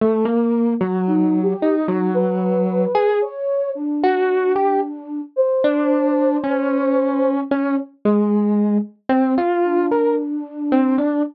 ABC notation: X:1
M:7/8
L:1/16
Q:1/4=56
K:none
V:1 name="Electric Piano 1"
A, ^A,2 ^F,3 ^D F,4 ^G z2 | z ^F2 G z3 D3 ^C4 | ^C z ^G,3 z =C F2 ^A z2 C D |]
V:2 name="Flute"
z4 (3^D2 G2 D2 B4 ^c2 | D6 c8 | z8 D6 |]